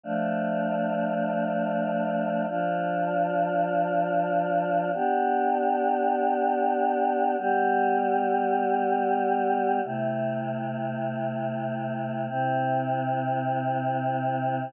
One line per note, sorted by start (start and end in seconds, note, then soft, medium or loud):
0.03 2.46 F3 medium
0.03 2.46 A3 medium
0.03 2.46 D4 medium
2.48 4.91 F3 medium
2.48 4.91 D4 medium
2.48 4.91 F4 medium
4.93 7.36 B3 medium
4.93 7.36 D4 medium
4.93 7.36 G4 medium
7.38 9.80 G3 medium
7.38 9.80 B3 medium
7.38 9.80 G4 medium
9.84 12.27 C3 medium
9.84 12.27 A3 medium
9.84 12.27 E4 medium
12.28 14.71 C3 medium
12.28 14.71 C4 medium
12.28 14.71 E4 medium